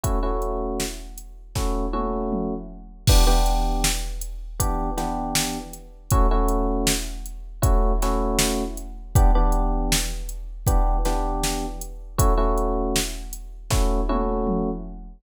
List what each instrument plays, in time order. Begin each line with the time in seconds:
0.03 electric piano 1 A3 C#4 E4 F#4, kick, closed hi-hat
0.23 electric piano 1 A3 C#4 E4 F#4
0.42 closed hi-hat
0.80 snare
1.18 closed hi-hat
1.55 electric piano 1 A3 C#4 E4 F#4, kick, snare
1.93 electric piano 1 A3 C#4 E4 F#4, high tom
2.32 mid tom
3.07 electric piano 1 E3 B3 D4 G4, kick, crash
3.27 electric piano 1 E3 B3 D4 G4
3.46 closed hi-hat
3.84 snare
4.21 closed hi-hat
4.60 electric piano 1 E3 B3 D4 G4, kick, closed hi-hat
4.97 electric piano 1 E3 B3 D4 G4, snare, closed hi-hat
5.35 snare
5.73 closed hi-hat
6.11 electric piano 1 A3 C#4 E4 F#4, kick, closed hi-hat
6.31 electric piano 1 A3 C#4 E4 F#4
6.48 closed hi-hat
6.87 snare
7.26 closed hi-hat
7.62 electric piano 1 A3 C#4 E4 F#4, kick, closed hi-hat
8.02 electric piano 1 A3 C#4 E4 F#4, snare, closed hi-hat
8.39 snare
8.77 closed hi-hat
9.15 electric piano 1 E3 B3 D4 G4, kick, closed hi-hat
9.35 electric piano 1 E3 B3 D4 G4
9.52 closed hi-hat
9.92 snare
10.29 closed hi-hat
10.67 electric piano 1 E3 B3 D4 G4, kick, closed hi-hat
11.05 electric piano 1 E3 B3 D4 G4, snare, closed hi-hat
11.44 snare
11.81 closed hi-hat
12.18 electric piano 1 A3 C#4 E4 F#4, kick, closed hi-hat
12.38 electric piano 1 A3 C#4 E4 F#4
12.58 closed hi-hat
12.96 snare
13.33 closed hi-hat
13.70 electric piano 1 A3 C#4 E4 F#4, kick, snare
14.09 electric piano 1 A3 C#4 E4 F#4, high tom
14.47 mid tom